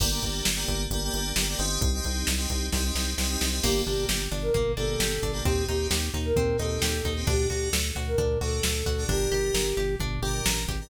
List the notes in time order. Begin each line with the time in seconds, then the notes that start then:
0.00 G1 A#3 D4 G4, kick, crash
0.11 A#3 D4 G4
0.22 G1, kick, closed hi-hat
0.45 G1, snare
0.56 A#3 D4 G4
0.68 G1, kick, closed hi-hat
0.90 G1 A#3 D4 G4, kick, closed hi-hat
1.04 A#3 D4 G4
1.13 G1 A#3 D4 G4, closed hi-hat
1.36 G1 A#3 D4 G4, snare
1.49 A#3 D4 G4
1.58 G1 C4 D#4 G4, closed hi-hat
1.81 C2, kick, closed hi-hat
1.94 C4 D#4 G4
2.04 C2, kick, closed hi-hat
2.27 C2, snare
2.37 C4 D#4 G4
2.50 C2, kick, closed hi-hat
2.72 C2 C4 D#4 G4, kick, snare
2.84 C4 D#4 G4
2.94 C2 C4 D#4 G4, snare
3.18 C2 C4 D#4 G4, snare
3.30 C4 D#4 G4
3.39 C2 C4 D#4 G4, snare
3.52 C4 D#4 G4
3.63 G1 A#3 D4 G4, kick, crash
3.85 G1 A#3 D4 G4, floor tom
4.09 G1 G4, snare
4.31 G1 D4, floor tom
4.42 A#4
4.54 G1 A#3, kick, floor tom
4.77 G1 A#3 D4 G4 A4, floor tom
5.00 G1 G4, snare
5.22 G1 D4, kick, floor tom
5.33 A#3 D4 G4
5.45 D#2 C4 D#4 G4, kick, floor tom
5.68 D#2 C4 D#4 G4, floor tom
5.91 D#2 G4, snare
6.14 D#2 D#4, floor tom
6.25 A#4
6.36 D#2 C4, kick, floor tom
6.58 D#2 C4 D#4 G4 A4, floor tom
6.82 D#2 G4, snare
7.04 D#2 D#4, kick, floor tom
7.16 C4 D#4 G4
7.27 D2 D4 F#4 G4 A4, kick, floor tom
7.49 D2 D4 F#4 G4 A4, floor tom
7.73 D2 A4, snare
7.95 D2 F#4, floor tom
8.07 A#4
8.18 D2 D4, kick, floor tom
8.41 D2 D4 F#4 A4, floor tom
8.63 D2 A4, snare
8.86 D2 F#4, kick, floor tom
8.98 D4 F#4 A4
9.08 G1 D4 G4 A#4, kick, floor tom
9.31 G1 D4 G4 A#4, floor tom
9.54 G1 A#4, snare
9.77 G1 G4, floor tom
10.00 G1 D4, kick, floor tom
10.22 G1 D4 G4 A#4, floor tom
10.46 A1 A#4, snare
10.68 G#1 G4, kick, floor tom
10.81 D4 G4 A#4